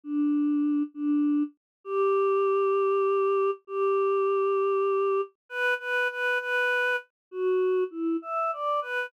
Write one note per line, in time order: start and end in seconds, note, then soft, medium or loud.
0.04 0.83 D4 medium
0.94 1.43 D4 medium
1.84 3.51 G4 medium
3.67 5.21 G4 medium
5.49 5.74 B4 medium
5.79 6.08 B4 medium
6.10 6.38 B4 medium
6.39 6.96 B4 medium
7.31 7.84 F#4 medium
7.91 8.17 E4 medium
8.22 8.51 E5 medium
8.53 8.80 D5 medium
8.82 9.06 B4 medium